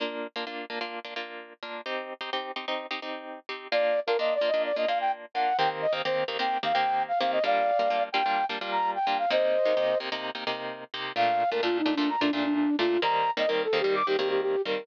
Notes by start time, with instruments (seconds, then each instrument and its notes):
0.00 acoustic guitar (steel) A#3 D4 F4
0.36 acoustic guitar (steel) A#3 D4 F4
0.47 acoustic guitar (steel) A#3 D4 F4
0.70 acoustic guitar (steel) A#3 D4 F4
0.81 acoustic guitar (steel) A#3 D4 F4
1.05 acoustic guitar (steel) A#3 D4 F4
1.16 acoustic guitar (steel) A#3 D4 F4
1.63 acoustic guitar (steel) A#3 D4 F4
1.86 acoustic guitar (steel) C4 D#4 G4
2.21 acoustic guitar (steel) C4 D#4 G4
2.33 acoustic guitar (steel) C4 D#4 G4
2.56 acoustic guitar (steel) C4 D#4 G4
2.68 acoustic guitar (steel) C4 D#4 G4
2.91 acoustic guitar (steel) C4 D#4 G4
3.02 acoustic guitar (steel) C4 D#4 G4
3.49 acoustic guitar (steel) C4 D#4 G4
3.72 acoustic guitar (steel) A#3 D4 F4, flute D5
4.07 acoustic guitar (steel) A#3 D4 F4, flute A#4
4.19 acoustic guitar (steel) A#3 D4 F4, flute D#5
4.35 flute D5
4.41 acoustic guitar (steel) A#3 D4 F4
4.48 flute D#5
4.54 acoustic guitar (steel) A#3 D4 F4
4.65 flute D5
4.76 acoustic guitar (steel) A#3 D4 F4, flute D#5
4.88 acoustic guitar (steel) A#3 D4 F4, flute F5
5.01 flute G5
5.34 acoustic guitar (steel) A#3 D4 F4, flute F#5
5.58 acoustic guitar (steel) D#3 A#3 C4 G4, flute G5
5.82 flute D#5
5.93 acoustic guitar (steel) D#3 A#3 C4 G4
6.05 acoustic guitar (steel) D#3 A#3 C4 G4, flute C5
6.28 acoustic guitar (steel) D#3 A#3 C4 G4
6.39 acoustic guitar (steel) D#3 A#3 C4 G4, flute G5
6.63 acoustic guitar (steel) D#3 A#3 C4 G4, flute F5
6.74 acoustic guitar (steel) D#3 A#3 C4 G4, flute G5
7.08 flute F5
7.20 acoustic guitar (steel) D#3 A#3 C4 G4, flute F5
7.33 flute D#5
7.44 acoustic guitar (steel) G3 A#3 D4 F4, flute D5 F5
7.79 acoustic guitar (steel) G3 A#3 D4 F4
7.90 acoustic guitar (steel) G3 A#3 D4 F4
8.12 acoustic guitar (steel) G3 A#3 D4 F4, flute G5
8.26 acoustic guitar (steel) G3 A#3 D4 F4
8.49 acoustic guitar (steel) G3 A#3 D4 F4
8.61 acoustic guitar (steel) G3 A#3 D4 F4
8.72 flute A#5
8.95 flute G5
9.07 acoustic guitar (steel) G3 A#3 D4 F4
9.19 flute F5
9.31 acoustic guitar (steel) C3 A#3 D#4 G4, flute C5 D#5
9.65 acoustic guitar (steel) C3 A#3 D#4 G4
9.77 acoustic guitar (steel) C3 A#3 D#4 G4
10.00 acoustic guitar (steel) C3 A#3 D#4 G4
10.12 acoustic guitar (steel) C3 A#3 D#4 G4
10.35 acoustic guitar (steel) C3 A#3 D#4 G4
10.47 acoustic guitar (steel) C3 A#3 D#4 G4
10.94 acoustic guitar (steel) C3 A#3 D#4 G4
11.16 acoustic guitar (steel) A#2 A3 D4 F4, flute F5
11.51 acoustic guitar (steel) A#2 A3 D4 F4, flute A#4
11.63 acoustic guitar (steel) A#2 A3 D4 F4, flute F4
11.79 flute D#4
11.86 acoustic guitar (steel) A#2 A3 D4 F4
11.95 acoustic guitar (steel) A#2 A3 D4 F4, flute D4
12.09 flute A#5
12.21 acoustic guitar (steel) A#2 A3 D4 F4, flute D4
12.33 acoustic guitar (steel) A#2 A3 D4 F4, flute D4
12.45 flute D4
12.55 flute D4
12.79 acoustic guitar (steel) A#2 A3 D4 F4, flute F4
13.02 acoustic guitar (steel) D#3 G3 A#3 C4, flute A#5
13.37 acoustic guitar (steel) D#3 G3 A#3 C4, flute D#5
13.48 acoustic guitar (steel) D#3 G3 A#3 C4, flute A#4
13.64 flute A4
13.73 acoustic guitar (steel) D#3 G3 A#3 C4
13.80 acoustic guitar (steel) D#3 G3 A#3 C4, flute G4
13.95 flute D6
14.07 acoustic guitar (steel) D#3 G3 A#3 C4, flute G4
14.18 acoustic guitar (steel) D#3 G3 A#3 C4, flute G4
14.30 flute G4
14.42 flute G4
14.65 acoustic guitar (steel) D#3 G3 A#3 C4, flute A#4